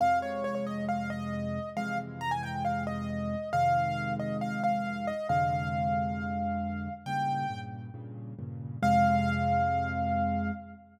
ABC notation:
X:1
M:4/4
L:1/16
Q:1/4=136
K:Fm
V:1 name="Acoustic Grand Piano"
f2 d2 d d e2 f2 e6 | f2 z2 b a g2 f2 e6 | f6 e2 f2 f4 e2 | f16 |
g6 z10 | f16 |]
V:2 name="Acoustic Grand Piano" clef=bass
[F,,C,A,]16 | [F,,C,=E,A,]16 | [F,,C,E,A,]16 | [F,,C,=D,A,]16 |
[G,,B,,D,]4 [G,,B,,D,]4 [G,,B,,D,]4 [G,,B,,D,]4 | [F,,C,A,]16 |]